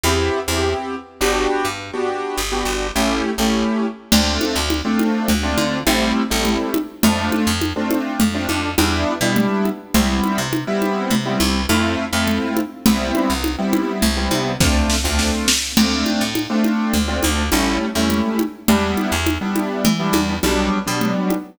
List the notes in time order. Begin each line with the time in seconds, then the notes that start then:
0.04 E2 B3 C4 E4 G4
0.48 E2 B3 C4 E4 G4
1.21 G1 B3 D4 F#4 G4
1.65 G2
1.93 B3 D4 F#4 G4
2.37 G1
2.52 B3 D4 F#4 G4
2.65 G1
2.95 A1 A3 C#4 E4 G4
3.38 A1 A3 C#4 E4 G4
4.12 D2 A3 C4 D4 F4, crash, low conga
4.41 high conga
4.56 D2
4.70 high conga
4.85 A3 C4 D4 F4
4.99 high conga
5.28 D2, low conga
5.43 A3 C4 D4 F4
5.57 D3, high conga
5.87 A1 G3 A3 C4 E4, high conga
6.30 A1 G3 A3 C4 E4
6.45 low conga
6.74 high conga
7.03 F2 A3 C4 D4 F4, low conga
7.32 high conga
7.47 F2
7.61 high conga
7.76 A3 C4 D4 F4
7.91 high conga
8.20 F2, low conga
8.34 A3 C4 D4 F4
8.49 F2, high conga
8.78 E2 G3 B3 D4 E4, high conga
9.21 B2 G3 B3 D4 E4
9.36 low conga
9.65 high conga
9.94 C2 G3 B3 C4 E4, low conga
10.24 high conga
10.38 C3
10.53 high conga
10.67 G3 B3 C4 E4
10.82 high conga
11.10 C3, low conga
11.25 G3 B3 C4 E4
11.40 C2, high conga
11.69 F2 A3 C4 E4 F4, high conga
12.13 F2 A3 C4 E4 F4
12.27 low conga
12.57 high conga
12.86 C2 G3 B3 C4 E4, low conga
13.15 high conga
13.30 C2
13.44 high conga
13.58 G3 B3 C4 E4
13.73 high conga
14.02 C2, low conga
14.17 G3 B3 C4 E4
14.31 C3, high conga
14.60 D2 A3 C4 D4 F4, kick, snare
14.90 snare
15.04 D2 A3 C4 D4 F4
15.19 snare
15.48 snare
15.77 D2 A3 C4 D4 F4, crash, low conga
16.06 high conga
16.21 A2
16.35 high conga
16.50 A3 C4 D4 F4
16.64 high conga
16.93 D2, low conga
17.08 A3 C4 D4 F4
17.23 D2, high conga
17.52 A1 G3 A3 C#4 E4, high conga
17.95 E2 G3 A3 C#4 E4
18.10 low conga
18.39 high conga
18.68 E2 G3 B3 D4 E4, low conga
18.97 high conga
19.12 E2
19.26 high conga
19.41 G3 B3 D4 E4
19.56 high conga
19.85 E3, low conga
19.99 G3 B3 D4 E4
20.13 E2, high conga
20.43 B1 F#3 G3 B3 D4, high conga
20.87 B2 F#3 G3 B3 D4
21.01 low conga
21.30 high conga